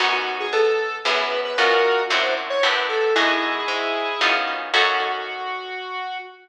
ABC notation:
X:1
M:3/4
L:1/16
Q:1/4=114
K:F#dor
V:1 name="Lead 1 (square)"
F F2 G A4 B3 B | [F^A]4 =c2 z ^c B2 =A2 | [EG]10 z2 | F12 |]
V:2 name="Acoustic Guitar (steel)"
[B,CDF]8 [B,CEG]4 | [CD^EF]4 [=C=D=EF]4 [B,DE=G]4 | [B,DFG]8 [B,CD^E]4 | [CDFA]12 |]
V:3 name="Electric Bass (finger)" clef=bass
F,,4 B,,4 F,,4 | F,,4 F,,4 F,,4 | F,,4 G,,4 F,,4 | F,,12 |]